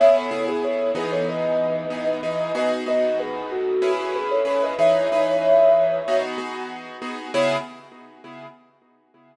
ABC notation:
X:1
M:4/4
L:1/16
Q:1/4=94
K:C#m
V:1 name="Ocarina"
[ce] [Ac]2 [GB] [Ac]2 [GB] [Ac] [Bd]8 | [M:7/8] [Bd] z [Bd]2 [GB]2 [FA]3 [FA] [GB] [Ac] [Ac] [Bd] | [M:4/4] [ce]10 z6 | [M:7/8] c4 z10 |]
V:2 name="Acoustic Grand Piano"
[C,B,EG]2 [C,B,EG]4 [E,B,DG]6 [E,B,DG]2 [E,B,DG]2 | [M:7/8] [B,DFG]2 [B,DFG]6 [CEGB]4 [CEGB]2 | [M:4/4] [E,DGB]2 [E,DGB]6 [B,DFG]2 [B,DFG]4 [B,DFG]2 | [M:7/8] [C,B,EG]4 z10 |]